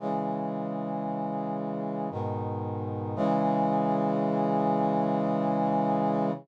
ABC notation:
X:1
M:3/4
L:1/8
Q:1/4=57
K:C#m
V:1 name="Brass Section" clef=bass
[C,E,G,]4 [G,,B,,D,]2 | [C,E,G,]6 |]